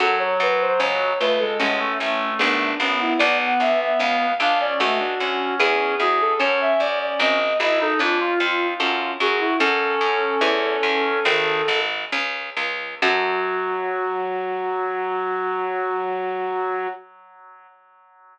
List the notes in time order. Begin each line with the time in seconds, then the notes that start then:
0.00 F#2 F#3 C#4 F#4 A4
0.19 C#5
0.40 F#2 B4
0.61 C5
0.80 C#2 C#4 C#5
1.20 C#2 A3 F4 B4
1.39 G#3 A4
1.59 A1 G#3 C#4 F#4 A4
1.79 A3
2.00 A1 A3
2.39 G#1 B3 D4 G#4
2.80 G#1 B3 C#4
3.01 E4
3.19 B1 B3 D5
3.39 F#5
3.60 B1 D4 E5
3.80 E5
3.99 C#2 C#4 F5
4.40 C#2 D4 F4 F5
4.60 C#4 D5
4.79 C#2 A3 C#4 F#4 A4
5.00 D4
5.20 D2 C#4
5.60 E2 B3 E4 G#4
6.00 E2 F#4 G#4
6.21 A4
6.39 F#2 C#4 F#4 A4 C#5
6.61 E5
6.80 F#2 D5
7.01 D5
7.20 G#1 C4 D#5
7.60 G#1 E4 G#4 D#5
7.81 D#4 A4
7.99 F2 C#4 D4 F4
8.20 F4
8.40 F2 F4
8.79 F#2 C#4 F#4 A4
9.20 F#2 F#4 G#4
9.40 E4
9.59 F#2 C#4 F#4 A4
10.01 F#2
10.41 E2 B3 E4 G#4
10.83 E2
11.25 G#1 D#3 C4
11.68 G#1 G#4
12.12 C#2 C#4
12.57 C#2 F4
13.02 F#2 F#3 C#4 F#4 A4